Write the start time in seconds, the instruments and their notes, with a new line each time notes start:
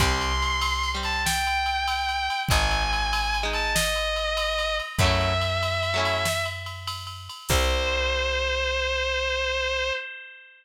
0.00 electric bass (finger) C2, overdriven guitar G3 C4, distortion guitar C6, kick, ride
0.21 ride
0.42 ride
0.61 ride
0.83 ride
0.95 overdriven guitar G3 C4
1.03 distortion guitar A5, ride
1.25 distortion guitar G5, snare
1.47 ride
1.66 ride
1.88 ride
2.09 ride
2.30 ride
2.49 electric bass (finger) G#1, overdriven guitar G#3 D#4, distortion guitar G#5, kick, ride
2.71 ride
2.93 ride
3.13 ride
3.34 ride
3.43 overdriven guitar G#3 D#4
3.53 distortion guitar A5, ride
3.75 distortion guitar D#5, snare
3.96 ride
4.16 ride
4.37 ride
4.58 ride
4.79 ride
4.99 electric bass (finger) F#2, overdriven guitar F#3 A3, distortion guitar E5, kick, ride
5.04 overdriven guitar C#4 E4
5.21 ride
5.41 ride
5.63 ride
5.83 ride
5.94 overdriven guitar F#3 A3 C#4
5.99 overdriven guitar E4
6.05 ride
6.25 snare
6.45 ride
6.66 ride
6.87 ride
7.07 ride
7.29 ride
7.49 electric bass (finger) C2, overdriven guitar G3 C4, distortion guitar C5, kick, crash